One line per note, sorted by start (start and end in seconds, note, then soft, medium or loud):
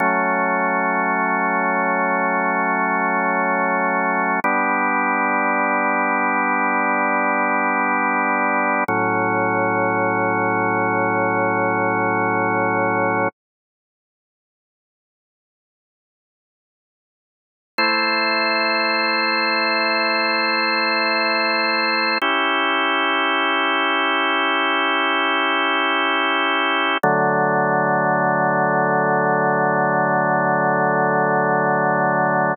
0.00 4.40 F#3 medium
0.00 4.40 A3 medium
0.00 4.40 C#4 medium
4.44 8.84 G3 medium
4.44 8.84 B3 medium
4.44 8.84 D4 medium
8.88 13.28 A2 medium
8.88 13.28 F#3 medium
8.88 13.28 C#4 medium
17.78 22.18 A3 medium
17.78 22.18 E4 medium
17.78 22.18 C5 medium
22.22 26.98 C#4 medium
22.22 26.98 E4 medium
22.22 26.98 G4 medium
27.03 32.54 D3 loud
27.03 32.54 F#3 loud
27.03 32.54 A3 medium